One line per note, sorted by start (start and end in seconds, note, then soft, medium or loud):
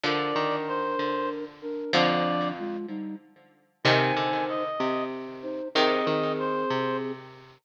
0.03 1.40 D3 medium
0.03 0.33 D3 medium
0.03 1.40 F3 medium
0.03 1.45 D4 medium
0.03 1.45 A#4 loud
0.03 0.56 D5 loud
0.36 0.95 D#3 medium
0.67 1.29 C5 medium
0.99 1.84 D3 medium
1.62 1.92 D4 medium
1.62 1.92 A#4 loud
1.93 2.77 F2 medium
1.93 2.84 D3 loud
1.93 2.52 F3 loud
1.93 2.84 F3 loud
1.93 2.52 D4 loud
1.93 2.48 D5 loud
2.58 2.86 G#3 medium
2.58 2.86 F4 loud
2.88 3.15 G3 medium
2.88 3.15 D#4 loud
3.84 4.12 C3 medium
3.84 5.07 C3 loud
3.84 5.07 D#3 loud
3.84 4.63 D#4 loud
3.84 4.63 C5 loud
3.84 4.45 G#5 medium
4.17 4.69 D3 medium
4.49 5.04 D#5 medium
4.80 5.61 C3 medium
5.42 5.68 D#4 medium
5.42 5.68 C5 loud
5.75 7.29 C3 loud
5.75 6.03 D#3 medium
5.75 7.29 D#3 loud
5.75 7.12 C4 loud
5.75 7.12 G#4 loud
5.75 6.33 D#5 loud
6.07 6.65 D#3 medium
6.39 6.97 C5 medium
6.70 7.58 C3 medium